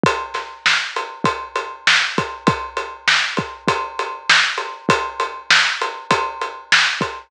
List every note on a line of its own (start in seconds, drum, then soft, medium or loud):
0.04 kick loud
0.04 closed hi-hat loud
0.34 snare soft
0.34 closed hi-hat medium
0.66 snare loud
0.96 closed hi-hat medium
1.24 kick loud
1.24 closed hi-hat loud
1.56 closed hi-hat medium
1.87 snare loud
2.18 kick loud
2.18 closed hi-hat medium
2.47 kick loud
2.47 closed hi-hat loud
2.77 closed hi-hat medium
3.08 snare loud
3.37 kick loud
3.37 closed hi-hat medium
3.68 kick loud
3.68 closed hi-hat loud
3.99 closed hi-hat medium
4.30 snare loud
4.58 closed hi-hat medium
4.89 kick loud
4.89 closed hi-hat loud
5.20 closed hi-hat medium
5.51 snare loud
5.81 closed hi-hat medium
6.11 kick medium
6.11 closed hi-hat loud
6.41 closed hi-hat medium
6.72 snare loud
7.01 kick medium
7.01 closed hi-hat medium